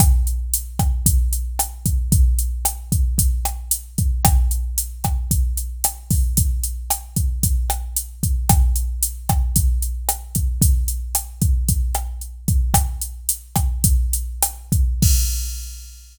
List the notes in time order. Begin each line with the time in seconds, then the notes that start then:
0.00 kick, cross-stick, closed hi-hat
0.27 closed hi-hat
0.54 closed hi-hat
0.79 kick, cross-stick, closed hi-hat
1.06 kick, closed hi-hat
1.33 closed hi-hat
1.59 cross-stick, closed hi-hat
1.86 kick, closed hi-hat
2.12 kick, closed hi-hat
2.39 closed hi-hat
2.65 cross-stick, closed hi-hat
2.92 kick, closed hi-hat
3.18 kick, closed hi-hat
3.45 cross-stick, closed hi-hat
3.71 closed hi-hat
3.98 kick, closed hi-hat
4.25 kick, cross-stick, closed hi-hat
4.51 closed hi-hat
4.78 closed hi-hat
5.04 kick, cross-stick, closed hi-hat
5.31 kick, closed hi-hat
5.57 closed hi-hat
5.84 cross-stick, closed hi-hat
6.11 kick, open hi-hat
6.37 kick, closed hi-hat
6.63 closed hi-hat
6.90 cross-stick, closed hi-hat
7.16 kick, closed hi-hat
7.43 kick, closed hi-hat
7.70 cross-stick, closed hi-hat
7.96 closed hi-hat
8.23 kick, closed hi-hat
8.49 kick, cross-stick, closed hi-hat
8.76 closed hi-hat
9.03 closed hi-hat
9.29 kick, cross-stick, closed hi-hat
9.56 kick, closed hi-hat
9.82 closed hi-hat
10.09 cross-stick, closed hi-hat
10.35 kick, closed hi-hat
10.62 kick, closed hi-hat
10.88 closed hi-hat
11.15 cross-stick, closed hi-hat
11.42 kick, closed hi-hat
11.68 kick, closed hi-hat
11.94 cross-stick, closed hi-hat
12.21 closed hi-hat
12.48 kick, closed hi-hat
12.74 kick, cross-stick, closed hi-hat
13.01 closed hi-hat
13.29 closed hi-hat
13.56 kick, cross-stick, closed hi-hat
13.84 kick, closed hi-hat
14.13 closed hi-hat
14.42 cross-stick, closed hi-hat
14.72 kick, closed hi-hat
15.02 kick, crash